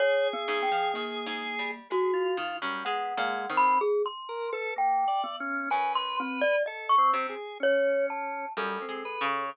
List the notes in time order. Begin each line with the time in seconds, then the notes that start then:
0.00 G#4 C#5
0.33 B3
0.48 G#2
0.63 G5
0.72 F3
0.94 D#3 A#3
1.26 G#2
1.59 G3
1.90 G#3 F#4 G#4
2.13 F4
2.37 D#3
2.62 F#2 G3
2.85 G#3 B3 F#5
3.17 A#2 G#3
3.50 D#3 C4
3.57 B5
3.81 G#4
4.06 C6
4.29 A#4
4.52 A4 B4
4.76 A#3 G5
5.08 D5
5.24 B3
5.40 C#4
5.70 F#2 B4 G#5
5.95 C6
6.20 C4
6.41 D5
6.66 A4 D#5
6.89 C#6
6.98 C4
7.13 C3
7.29 G#4
7.60 C#4 C#5
8.10 A5
8.57 F#2 G3 A4
8.82 C4
8.89 G#3
9.05 B4
9.21 C#3
9.29 C#5